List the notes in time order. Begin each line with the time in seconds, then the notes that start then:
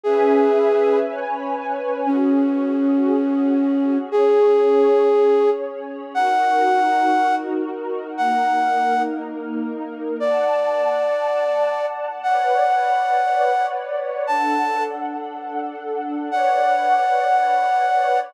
0.03 C#4 G#4 B4 E5 G#5
1.06 C#4 B4 C#5 G#5
2.06 C#4 F#4 G#4
4.11 C#4 G#4 C#5
6.14 D#4 F#4 A#4 F#5
8.17 A#3 D#4 A#4 F#5
10.20 D5 F#5 A5
12.23 B4 C#5 D5 F#5
14.27 D4 A4 F#5 A5
16.31 B4 C#5 D5 F#5